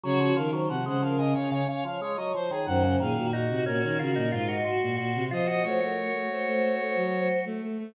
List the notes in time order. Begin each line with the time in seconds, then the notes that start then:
0.04 C#3 F#3 F#4 C#5
0.20 F3
0.35 D#3 F3 A#4 F5
0.53 F#3 C5
0.69 C3 F3 F#5
0.86 C#3 G#3 C5 F#5
1.02 F3 A#4 F5
1.18 C#3 D#5
1.34 C#3 C#5 F5
1.52 C#3 C#5
1.68 C#3 C#5 F5
1.85 F3 C#5 F5
2.01 G#3 C#5
2.16 F#3 D#5
2.34 F3 C5
2.51 D#3 G#4
2.66 F#2 D#3 C5 F#5
2.84 C#3
3.00 A#2 D#3 G#4 F5
3.17 A#2 F#4
3.32 D#4 F#4
3.50 C3 F#4
3.66 A#2 C#4 F#4 A#4
3.83 D#3 C#4
3.99 C#3 F4 F#4
4.16 A#2 D#4
4.32 G#2 F4
4.48 D#4 F#4
4.63 F#4 C6
4.82 A#2
4.98 A#2 F#4
5.15 C3
5.31 F3 F4 C5 D#5
5.47 F#4 C5 D#5
5.64 A3 F#4 C5 C#5
5.80 A3 F#4 A#4
5.97 A#4
6.13 A3
6.29 A3 C5
6.47 A3
6.63 A3
6.79 A3
6.95 F#3
7.45 A3
7.62 A3
7.78 A3